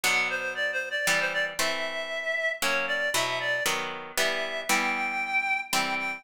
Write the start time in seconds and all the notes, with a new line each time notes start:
0.03 B2 F#3 D4 F#5
0.30 C5
0.55 D5
0.72 C5
0.91 D5
1.07 E3 G3 B3 D5
1.20 C5
1.33 D5
1.59 E3 A3 C4 E5
2.62 F#3 A#3 C#4 C#5
2.88 D5
3.14 B2 F#3 E4 E5
3.40 D5
3.66 D#3 F#3 B3
4.17 E3 G3 B3 E5
4.69 E3 G3 B3 G5
5.73 E3 G3 C4 G5
5.99 G5